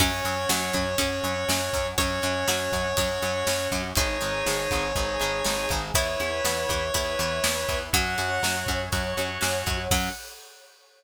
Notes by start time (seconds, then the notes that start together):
0.00 F#2 F#3 C#4 F#4 C#5, kick, crash
0.25 F#2 F#3 C#4, ride
0.49 F#2 F#3 C#4, snare
0.73 F#2 F#3 C#4, kick, ride
0.98 F#2 F#3 C#4 F#4, kick, ride
1.24 F#2 F#3 C#4, ride
1.49 F#2 F#3 C#4, snare
1.73 F#2 F#3 C#4, kick, ride
1.98 F#2 F#3 C#4 F#4 C#5, kick, ride
2.22 F#2 F#3 C#4, ride
2.48 F#2 F#3 C#4 F#4, snare
2.72 F#2 F#3 C#4, kick, ride
2.97 F#2 F#3 C#4 F#4 C#5, kick, ride
3.22 F#2 F#3 C#4, ride
3.47 F#2 F#3 C#4, snare
3.71 F#2 F#3 C#4, kick, ride
3.95 G#1 G#3 D#4 G#4 C#5, kick, ride
4.21 G#1 G#3 D#4, ride
4.46 G#1 G#3 D#4, snare
4.71 G#1 G#3 D#4, kick, ride
4.95 G#1 G#3 D#4 G#4, kick
5.20 G#1 G#3 D#4, ride
5.44 G#1 G#3 D#4, snare
5.69 G#1 G#3 D#4, kick, ride
5.94 E2 B3 E4 B4 C#5, kick, ride
6.20 E2 B3 E4, ride
6.45 E2 B3 E4, snare
6.69 E2 B3 E4, kick, ride
6.94 E2 B3 E4 B4, kick, ride
7.19 E2 B3 E4, ride
7.44 E2 B3 E4, snare
7.69 E2 B3 E4, kick, ride
7.93 F#2 F#3 C#4 F#4 C#5 F#5, kick, ride
8.18 F#2 C#4 F#4, ride
8.43 F#2 C#4 F#4, snare
8.67 F#2 C#4 F#4, kick, ride
8.92 F#2 C#4 F#4 C#5, kick, ride
9.17 F#2 C#4 F#4, ride
9.41 F#2 C#4 F#4, snare
9.66 F#2 C#4 F#4, kick, ride
9.91 F#2 F#3 C#4 F#4 F#5, kick, crash